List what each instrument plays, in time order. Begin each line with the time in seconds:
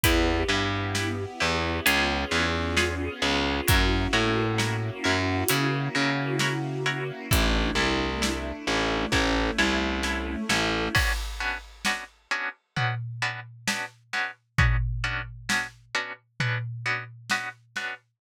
0.03 electric bass (finger) E2, string ensemble 1 B3 E4 G4, pizzicato strings E4 G4 B4, kick, closed hi-hat
0.48 electric bass (finger) G2, pizzicato strings E4 G4 B4
0.95 pizzicato strings E4 G4 B4, snare
1.40 electric bass (finger) E2, pizzicato strings E4 G4 B4
1.86 electric bass (finger) C#2, string ensemble 1 B3 C#4 F4 G#4, pizzicato strings F4 G#4 B4 C#5, closed hi-hat
2.31 electric bass (finger) E2, pizzicato strings F4 G#4 B4 C#5
2.77 pizzicato strings F4 G#4 B4 C#5, snare
3.22 electric bass (finger) C#2, pizzicato strings F4 G#4 B4 C#5, snare
3.68 electric bass (finger) F#2, string ensemble 1 A#3 C#4 E4 F#4, pizzicato strings E4 F#4 A#4 C#5, kick, closed hi-hat
4.13 electric bass (finger) A2, pizzicato strings E4 F#4 A#4 C#5
4.58 pizzicato strings E4 F#4 A#4 C#5, snare
5.04 electric bass (finger) F#2, pizzicato strings E4 F#4 A#4 C#5
5.48 electric bass (finger) C#3, pizzicato strings E4 F#4 A#4 C#5, closed hi-hat
5.95 electric bass (finger) C#3, pizzicato strings E4 F#4 A#4 C#5
6.39 pizzicato strings E4 F#4 A#4 C#5, snare
6.86 pizzicato strings E4 F#4 A#4 C#5, snare
7.31 electric bass (finger) A1, string ensemble 1 A3 D4 E4, pizzicato strings E4 A4 D5, kick, closed hi-hat
7.75 electric bass (finger) C2, pizzicato strings E4 A4 D5
8.22 pizzicato strings E4 A4 D5, snare
8.67 electric bass (finger) A1, pizzicato strings E4 A4 D5
9.11 electric bass (finger) A1, string ensemble 1 A3 C#4 E4, pizzicato strings E4 A4 C#5, kick, snare
9.58 electric bass (finger) C2, pizzicato strings E4 A4 C#5, snare
10.03 pizzicato strings E4 A4 C#5, snare
10.49 electric bass (finger) A1, pizzicato strings E4 A4 C#5, snare
10.95 pizzicato strings B3 C#4 D4 F#4, kick, crash
11.40 pizzicato strings B3 C#4 D4 F#4
11.85 pizzicato strings B3 C#4 D4 F#4, snare
12.31 pizzicato strings B3 C#4 D4 F#4
12.76 pizzicato strings B3 C#4 D4 F#4, floor tom
13.22 pizzicato strings B3 C#4 D4 F#4
13.67 pizzicato strings B3 C#4 D4 F#4, snare
14.13 pizzicato strings B3 C#4 D4 F#4, snare
14.58 pizzicato strings B3 C#4 D4 F#4, kick, floor tom
15.04 pizzicato strings B3 C#4 D4 F#4
15.49 pizzicato strings B3 C#4 D4 F#4, snare
15.95 pizzicato strings B3 C#4 D4 F#4
16.40 pizzicato strings B3 C#4 D4 F#4, floor tom
16.86 pizzicato strings B3 C#4 D4 F#4
17.30 pizzicato strings B3 C#4 D4 F#4, snare
17.76 pizzicato strings B3 C#4 D4 F#4, snare